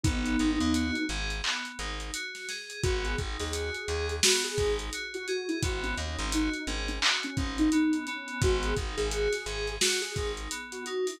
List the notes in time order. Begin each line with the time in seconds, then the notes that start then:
0.03 G#1 B3 D#4, kick, closed hi-hat
0.26 closed hi-hat
0.39 G#1 D#4, closed hi-hat
0.61 D#2, closed hi-hat
0.74 F#4, closed hi-hat
0.95 closed hi-hat
1.09 G#1 G#4, closed hi-hat
1.30 closed hi-hat
1.44 B3, clap
1.65 closed hi-hat
1.79 G#1 D#4, closed hi-hat
2.00 closed hi-hat
2.14 F#4, closed hi-hat
2.35 snare, closed hi-hat
2.49 G#4, snare, closed hi-hat
2.70 closed hi-hat
2.83 G#1 B3 F#4, kick, closed hi-hat
3.05 G#4, closed hi-hat
3.18 G#1 D#4, kick, closed hi-hat
3.40 D#2 G#4, snare, closed hi-hat
3.53 F#4, closed hi-hat
3.75 closed hi-hat
3.88 D#2 G#4, closed hi-hat
4.09 closed hi-hat
4.23 B3 F#4, snare
4.44 G#4, closed hi-hat
4.58 G#1 D#4, kick, closed hi-hat
4.79 closed hi-hat
4.93 F#4, closed hi-hat
5.14 F#4, closed hi-hat
5.27 F#4 G#4, closed hi-hat
5.48 E4, closed hi-hat
5.62 G#1 B3 F#4, kick, closed hi-hat
5.83 C#4, closed hi-hat
5.97 D#2 D#4, closed hi-hat
6.19 G#1, closed hi-hat
6.32 D#4 F#4, closed hi-hat
6.54 closed hi-hat
6.67 G#1 C#4 G#4, closed hi-hat
6.88 C#4, closed hi-hat
7.02 F#4, clap
7.23 C#4, closed hi-hat
7.37 G#1 C#4 D#4, kick, closed hi-hat
7.58 D#4, closed hi-hat
7.72 B3 D#4, closed hi-hat
7.93 closed hi-hat
8.07 B3 C#4, closed hi-hat
8.28 closed hi-hat
8.42 G#1 F#4, kick, closed hi-hat
8.63 G#4, closed hi-hat
8.77 G#1 D#4, kick, closed hi-hat
8.97 G#1 G#4, closed hi-hat
9.11 F#4, closed hi-hat
9.33 snare, closed hi-hat
9.46 G#1 G#4, closed hi-hat
9.68 closed hi-hat
9.81 F#4, snare
10.01 G#4, closed hi-hat
10.16 G#1 D#4, kick, closed hi-hat
10.37 closed hi-hat
10.51 B3, closed hi-hat
10.72 F#4, closed hi-hat
10.86 D#4 F#4, closed hi-hat
11.07 E4, open hi-hat